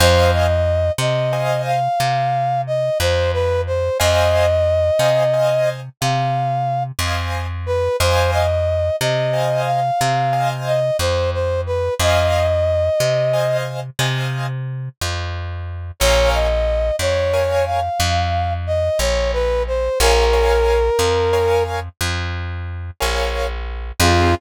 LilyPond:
<<
  \new Staff \with { instrumentName = "Brass Section" } { \time 12/8 \key f \minor \tempo 4. = 60 c''8 ees''4 ees''4 f''4. ees''8 c''8 b'8 c''8 | ees''2. f''4. r4 b'8 | c''8 ees''4 ees''4 f''4. ees''8 c''8 c''8 b'8 | ees''2~ ees''8 r2. r8 |
des''8 ees''4 des''4 f''4. ees''8 des''8 b'8 c''8 | bes'2. r2. | f'4. r1 r8 | }
  \new Staff \with { instrumentName = "Acoustic Grand Piano" } { \time 12/8 \key f \minor <c'' ees'' f'' aes''>2 <c'' ees'' f'' aes''>1 | <c'' ees'' f'' aes''>4. <c'' ees'' f'' aes''>8 <c'' ees'' f'' aes''>2~ <c'' ees'' f'' aes''>8 <c'' ees'' f'' aes''>4. | <c'' ees'' f'' aes''>2 <c'' ees'' f'' aes''>4. <c'' ees'' f'' aes''>2~ <c'' ees'' f'' aes''>8 | <c'' ees'' f'' aes''>2 <c'' ees'' f'' aes''>4 <c'' ees'' f'' aes''>2. |
<bes' des'' f'' aes''>2 <bes' des'' f'' aes''>1 | <bes' des'' f'' aes''>8 <bes' des'' f'' aes''>4. <bes' des'' f'' aes''>2~ <bes' des'' f'' aes''>8 <bes' des'' f'' aes''>4. | <c' ees' f' aes'>4. r1 r8 | }
  \new Staff \with { instrumentName = "Electric Bass (finger)" } { \clef bass \time 12/8 \key f \minor f,4. c4. c4. f,4. | f,4. c4. c4. f,4. | f,4. c4. c4. f,4. | f,4. c4. c4. f,4. |
bes,,4. f,4. f,4. bes,,4. | bes,,4. f,4. f,4. bes,,4. | f,4. r1 r8 | }
>>